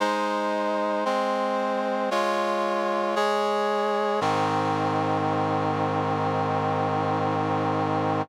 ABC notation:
X:1
M:4/4
L:1/8
Q:1/4=57
K:Ab
V:1 name="Brass Section"
[A,Ec]2 [A,Cc]2 [A,Fd]2 [A,Ad]2 | [A,,E,C]8 |]